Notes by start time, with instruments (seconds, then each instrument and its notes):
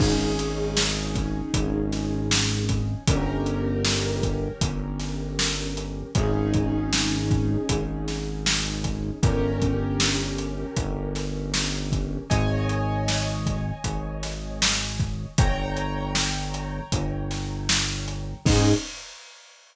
0.00 synth bass 1 G#1, acoustic grand piano C#4 D#4 G#4, kick, crash
0.39 closed hi-hat
0.77 snare
1.15 kick, closed hi-hat
1.54 synth bass 1 G#1, kick, closed hi-hat
1.92 snare, closed hi-hat
2.31 snare
2.69 kick, closed hi-hat
3.08 synth bass 1 G1, acoustic grand piano C#4 G4 A#4, kick, closed hi-hat
3.46 closed hi-hat
3.85 snare
4.23 kick, closed hi-hat
4.61 synth bass 1 G1, kick, closed hi-hat
5.00 snare, closed hi-hat
5.39 snare
5.77 closed hi-hat
6.15 synth bass 1 G#1, acoustic grand piano C#4 D#4 G#4, kick, closed hi-hat
6.54 kick, closed hi-hat
6.93 snare
7.31 kick, closed hi-hat
7.69 synth bass 1 G#1, kick, closed hi-hat
8.08 snare, closed hi-hat
8.46 snare
8.84 kick, closed hi-hat
9.23 synth bass 1 G1, acoustic grand piano C#4 G4 A#4, kick, closed hi-hat
9.62 kick, closed hi-hat
10.00 snare
10.38 closed hi-hat
10.76 synth bass 1 G1, kick, closed hi-hat
11.15 snare, closed hi-hat
11.54 snare
11.92 kick, closed hi-hat
12.30 synth bass 1 G#1, acoustic grand piano C#5 D#5 G#5, kick, closed hi-hat
12.69 closed hi-hat
13.08 snare
13.46 kick, closed hi-hat
13.84 synth bass 1 G#1, kick, closed hi-hat
14.23 snare, closed hi-hat
14.62 snare
15.00 kick, closed hi-hat
15.38 synth bass 1 G1, acoustic grand piano C#5 G5 A#5, kick, closed hi-hat
15.77 closed hi-hat
16.15 snare
16.54 closed hi-hat
16.92 synth bass 1 G1, kick, closed hi-hat
17.31 snare, closed hi-hat
17.69 snare
18.08 closed hi-hat
18.46 synth bass 1 G#2, acoustic grand piano C#4 D#4 G#4, kick, crash